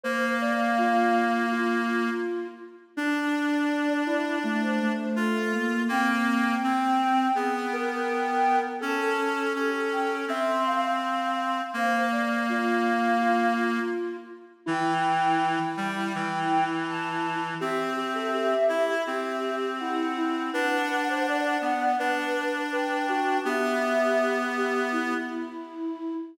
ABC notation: X:1
M:4/4
L:1/16
Q:1/4=82
K:Dm
V:1 name="Flute"
f12 z4 | d6 d2 d c2 c A4 | g16 | a4 G2 g2 c'8 |
f12 z4 | [K:Em] g12 a4 | e12 f4 | f12 g4 |
e10 z6 |]
V:2 name="Flute"
c2 d2 F4 F6 z2 | D6 E2 A,2 A,4 B,2 | C8 ^G2 B6 | A8 e2 f6 |
c2 d2 F4 F6 z2 | [K:Em] E16 | G2 G A G4 G4 E2 E2 | B2 B c d4 B4 B2 F2 |
G6 G2 E8 |]
V:3 name="Clarinet"
B,14 z2 | D12 F4 | B,4 C4 =B,8 | ^C4 C4 =C8 |
B,14 z2 | [K:Em] E,6 G,2 E,8 | C6 E2 C8 | D6 B,2 D8 |
B,10 z6 |]